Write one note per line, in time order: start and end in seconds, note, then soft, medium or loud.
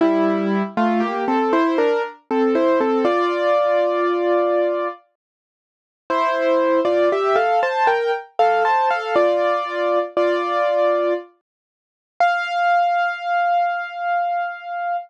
0.01 0.62 G3 medium
0.01 0.62 E4 loud
0.77 1.01 A3 medium
0.77 1.01 F4 loud
1.00 1.24 A#3 medium
1.00 1.24 G4 medium
1.28 1.52 C4 medium
1.28 1.52 A4 medium
1.53 1.77 E4 medium
1.53 1.77 C5 loud
1.78 2.02 D4 medium
1.78 2.02 A#4 loud
2.31 2.55 C4 medium
2.31 2.55 A4 medium
2.55 2.79 E4 medium
2.55 2.79 C5 medium
2.81 3.05 C4 medium
2.81 3.05 A4 medium
3.05 4.88 F4 medium
3.05 4.88 D5 loud
6.10 6.80 E4 medium
6.10 6.80 C5 loud
6.85 7.09 F4 medium
6.85 7.09 D5 medium
7.12 7.36 G4 medium
7.12 7.36 E5 medium
7.36 7.60 A4 medium
7.36 7.60 F5 medium
7.63 7.87 C5 medium
7.63 7.87 A5 medium
7.87 8.11 A#4 medium
7.87 8.11 G5 medium
8.39 8.63 A4 medium
8.39 8.63 F5 medium
8.65 8.89 C5 medium
8.65 8.89 A5 medium
8.90 9.15 A4 medium
8.90 9.15 F5 medium
9.16 9.99 F4 medium
9.16 9.99 D5 medium
10.17 11.14 F4 medium
10.17 11.14 D5 medium
12.20 14.97 F5 loud